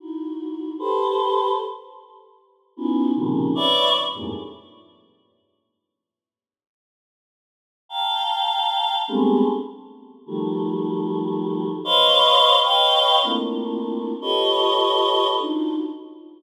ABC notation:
X:1
M:4/4
L:1/16
Q:1/4=76
K:none
V:1 name="Choir Aahs"
[_E=E_G]4 [=GABc]4 z6 [B,_D_E=EF_G]2 | [_B,,C,_D,_E,F,]2 [=B_d=d=e]2 z [F,,G,,_A,,=A,,_B,,] z10 | z8 [fga_b]6 [G,_A,=A,=B,CD]2 | z4 [_E,F,_G,=G,A,]8 [Bc_d_ef]4 |
[B_d_efg]3 [A,_B,C=D=EF]5 [FGA=B_d_e]6 [=D_EF_G]2 |]